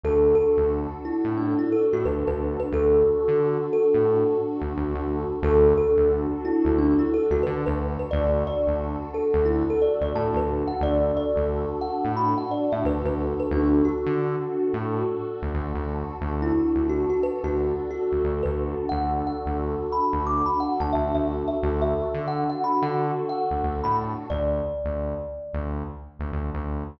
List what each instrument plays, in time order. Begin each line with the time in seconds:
0.03 synth bass 1 D2, pad 2 (warm) D4 F#4 A4, kalimba A4
0.35 kalimba A4
0.57 synth bass 1 D2
1.05 kalimba E4
1.25 synth bass 1 A2
1.37 kalimba D4
1.59 kalimba E4
1.72 kalimba A4
1.93 synth bass 1 A2, kalimba F#4
2.05 synth bass 1 D2, kalimba B4
2.27 synth bass 1 D2, kalimba B4
2.60 kalimba B4
2.72 synth bass 1 D2, pad 2 (warm) D4 F#4 A4, kalimba A4
3.28 synth bass 1 D3
3.73 kalimba A4
3.94 synth bass 1 A2
4.61 synth bass 1 D2
4.77 synth bass 1 D2
4.95 synth bass 1 D2
5.42 synth bass 1 D2, pad 2 (warm) D4 F#4 A4, kalimba A4
5.77 kalimba A4
5.97 synth bass 1 D2
6.45 kalimba E4
6.65 synth bass 1 D2
6.78 kalimba D4
6.99 kalimba E4
7.14 kalimba A4
7.30 synth bass 1 D2, kalimba F#4
7.43 synth bass 1 D3, kalimba B4
7.66 synth bass 1 D2, kalimba B4
7.99 kalimba B4
8.11 synth bass 1 D2, pad 2 (warm) D4 F#4 A4, kalimba D5
8.47 kalimba D5
8.67 synth bass 1 D2
9.14 kalimba A4
9.34 synth bass 1 D2
9.45 kalimba E4
9.70 kalimba A4
9.82 kalimba D5
10.01 synth bass 1 D2, kalimba D5
10.15 synth bass 1 A2, kalimba A5
10.34 synth bass 1 D2, kalimba B4
10.67 kalimba F#5
10.81 synth bass 1 D2, pad 2 (warm) D4 F#4 A4, kalimba D5
11.17 kalimba D5
11.36 synth bass 1 D2
11.81 kalimba F#5
12.04 synth bass 1 A2
12.17 kalimba B5
12.38 kalimba F#5
12.51 kalimba D5
12.72 synth bass 1 A2, kalimba E5
12.84 synth bass 1 D2, kalimba B4
13.04 synth bass 1 D2, kalimba B4
13.40 kalimba B4
13.51 synth bass 1 D2, pad 2 (warm) D4 F#4 A4, kalimba D4
13.85 kalimba F#4
14.06 synth bass 1 D3
14.73 synth bass 1 A2
15.42 synth bass 1 D2
15.54 synth bass 1 D2
15.74 synth bass 1 D2
16.21 synth bass 1 D2, pad 2 (warm) D4 F#4 A4
16.42 kalimba E4
16.76 synth bass 1 D2
16.89 kalimba F#4
17.10 kalimba F#4
17.23 kalimba B4
17.43 synth bass 1 D2, kalimba F#4
17.91 kalimba F#4
18.12 synth bass 1 D2
18.24 synth bass 1 D2
18.43 synth bass 1 D2, kalimba B4
18.89 synth bass 1 D2, pad 2 (warm) D4 F#4 A4, kalimba F#5
19.27 kalimba F#5
19.46 synth bass 1 D2
19.92 kalimba B5
20.13 synth bass 1 D2
20.27 kalimba D6
20.46 kalimba B5
20.60 kalimba F#5
20.80 synth bass 1 D2, kalimba A5
20.93 synth bass 1 D2, kalimba E5
21.14 synth bass 1 D2, kalimba E5
21.48 kalimba E5
21.61 synth bass 1 D2, pad 2 (warm) D4 F#4 A4
21.82 kalimba E5
22.14 synth bass 1 D3
22.28 kalimba F#5
22.49 kalimba F#5
22.64 kalimba B5
22.82 synth bass 1 D3, kalimba F#5
23.29 kalimba F#5
23.50 synth bass 1 D2
23.63 synth bass 1 D2
23.84 synth bass 1 A2, kalimba B5
24.30 synth bass 1 D2, kalimba D5
24.84 synth bass 1 D2
25.53 synth bass 1 D2
26.19 synth bass 1 D2
26.32 synth bass 1 D2
26.54 synth bass 1 D2